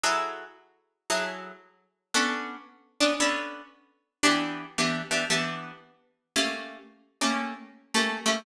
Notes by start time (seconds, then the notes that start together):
0.04 F#3 E4 G#4 A4
1.10 F#3 E4 G#4 A4
2.14 B3 C#4 D4 A4
3.00 B3 C#4 D4 A4
3.20 B3 C#4 D4 A4
4.23 E3 B3 D4 G4
4.78 E3 B3 D4 G4
5.11 E3 B3 D4 G4
5.30 E3 B3 D4 G4
6.36 A3 A#3 C#4 G4
7.21 A3 A#3 C#4 G4
7.94 A3 A#3 C#4 G4
8.26 A3 A#3 C#4 G4